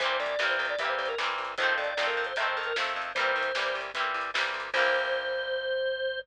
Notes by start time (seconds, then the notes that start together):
0.00 C2 E3 G3 A#3 C5, kick, closed hi-hat
0.05 C4
0.20 C2 D5
0.26 kick, closed hi-hat
0.39 C2 E3 G3, snare
0.43 A#3 C4
0.49 C5
0.59 C2
0.65 closed hi-hat
0.70 D5
0.79 C2 E3 G3 E5, kick, closed hi-hat
0.83 A#3 C4
0.89 C5
0.98 C2 C5
1.06 A#4, closed hi-hat
1.18 C2 E3 G3 A#3, snare
1.24 C4
1.38 C2
1.45 closed hi-hat
1.58 F2 D#3 F3 C5, kick, closed hi-hat
1.62 A3 C4
1.72 kick
1.78 F2 D5
1.84 closed hi-hat
1.97 F2 D#3 F3 A3, snare
2.02 C4
2.07 A#4
2.17 F2
2.25 C5, closed hi-hat
2.36 F2 D#3 F3 E5, kick, closed hi-hat
2.40 A3 C4
2.46 C5
2.57 F2 A#4
2.63 A#4, closed hi-hat
2.76 F2 D#3 F3 A3, snare
2.82 C4
2.96 F2
3.02 closed hi-hat
3.15 C2 E3 G3 C5, kick, closed hi-hat
3.19 A#3 C4
3.36 C2
3.41 kick, closed hi-hat
3.55 C2 E3 G3, snare
3.59 A#3 C4
3.75 C2
3.81 closed hi-hat
3.94 C2 E3 G3, kick, closed hi-hat
3.98 A#3 C4
4.14 C2
4.21 closed hi-hat
4.34 C2 E3 G3 A#3, snare
4.39 C4
4.54 C2
4.60 closed hi-hat
4.74 C2 E3 G3 A#3 C5, kick, crash
4.79 C4